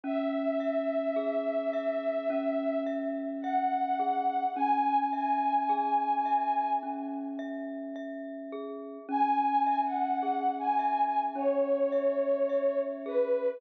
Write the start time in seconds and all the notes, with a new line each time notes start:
0.04 C#4 E5
0.60 E5
1.16 G#4
1.73 E5
2.30 C#4
2.87 E5
3.42 E5 F#5
3.99 G#4
4.56 C#4 G#5
5.13 E5 G#5
5.69 G#4
6.26 E5
6.83 C#4
7.39 E5
7.96 E5
8.52 G#4
9.09 C#4 G#5
9.67 E5
9.84 F#5
10.23 G#4
10.59 G#5
10.79 E5
11.35 C#4 C#5
11.92 E5
12.49 E5
13.06 G#4 B4